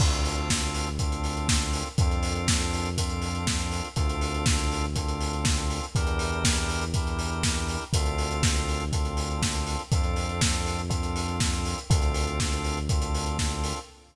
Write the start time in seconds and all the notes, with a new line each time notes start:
0.00 D2 C4 D4 F4 A4, kick, crash
0.13 closed hi-hat
0.25 open hi-hat
0.37 closed hi-hat
0.50 kick, snare
0.62 closed hi-hat
0.74 open hi-hat
0.86 closed hi-hat
0.99 C4 D4 F4 A4, kick, closed hi-hat
1.12 closed hi-hat
1.24 open hi-hat
1.37 closed hi-hat
1.48 kick, snare
1.61 closed hi-hat
1.73 open hi-hat
1.86 closed hi-hat
1.98 F2 C4 D4 F4 A4, kick, closed hi-hat
2.11 closed hi-hat
2.23 open hi-hat
2.35 closed hi-hat
2.48 kick, snare
2.61 closed hi-hat
2.73 open hi-hat
2.85 closed hi-hat
2.98 C4 D4 F4 A4, kick, closed hi-hat
3.10 closed hi-hat
3.22 open hi-hat
3.35 closed hi-hat
3.47 kick, snare
3.60 closed hi-hat
3.72 open hi-hat
3.84 closed hi-hat
3.96 D2 C4 D4 F4 A4, kick, closed hi-hat
4.09 closed hi-hat
4.21 open hi-hat
4.34 closed hi-hat
4.46 kick, snare
4.59 closed hi-hat
4.72 open hi-hat
4.84 closed hi-hat
4.96 C4 D4 F4 A4, kick, closed hi-hat
5.08 closed hi-hat
5.21 open hi-hat
5.33 closed hi-hat
5.45 kick, snare
5.57 closed hi-hat
5.70 open hi-hat
5.83 closed hi-hat
5.95 E2 D4 E4 G4 A#4, kick, closed hi-hat
6.07 closed hi-hat
6.19 open hi-hat
6.32 closed hi-hat
6.44 kick, snare
6.57 closed hi-hat
6.69 open hi-hat
6.81 closed hi-hat
6.94 D4 E4 G4 A#4, kick, closed hi-hat
7.07 closed hi-hat
7.19 open hi-hat
7.31 closed hi-hat
7.43 kick, snare
7.56 closed hi-hat
7.68 open hi-hat
7.81 closed hi-hat
7.93 D2 C4 D4 F4 A4, kick, closed hi-hat
8.06 closed hi-hat
8.18 open hi-hat
8.31 closed hi-hat
8.43 kick, snare
8.56 closed hi-hat
8.68 open hi-hat
8.80 closed hi-hat
8.92 C4 D4 F4 A4, kick, closed hi-hat
9.05 closed hi-hat
9.17 open hi-hat
9.30 closed hi-hat
9.42 kick, snare
9.55 closed hi-hat
9.67 open hi-hat
9.79 closed hi-hat
9.92 F2 C4 D4 F4 A4, kick, closed hi-hat
10.04 closed hi-hat
10.16 open hi-hat
10.29 closed hi-hat
10.41 kick, snare
10.54 closed hi-hat
10.66 open hi-hat
10.78 closed hi-hat
10.90 C4 D4 F4 A4, kick, closed hi-hat
11.03 closed hi-hat
11.16 open hi-hat
11.28 closed hi-hat
11.40 kick, snare
11.53 closed hi-hat
11.65 open hi-hat
11.78 closed hi-hat
11.90 D2 C4 D4 F4 A4, kick, closed hi-hat
12.02 closed hi-hat
12.14 open hi-hat
12.27 closed hi-hat
12.40 kick, snare
12.52 closed hi-hat
12.64 open hi-hat
12.77 closed hi-hat
12.89 C4 D4 F4 A4, kick, closed hi-hat
13.02 closed hi-hat
13.15 open hi-hat
13.26 closed hi-hat
13.38 kick, snare
13.51 closed hi-hat
13.64 open hi-hat
13.76 closed hi-hat